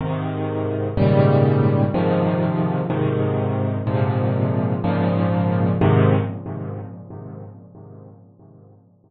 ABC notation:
X:1
M:6/8
L:1/8
Q:3/8=62
K:Ab
V:1 name="Acoustic Grand Piano" clef=bass
[A,,C,E,]3 [A,,B,,D,E,G,]3 | [A,,C,E,F,]3 [A,,C,E,]3 | [A,,B,,C,F,]3 [A,,B,,D,F,]3 | [A,,C,E,]3 z3 |]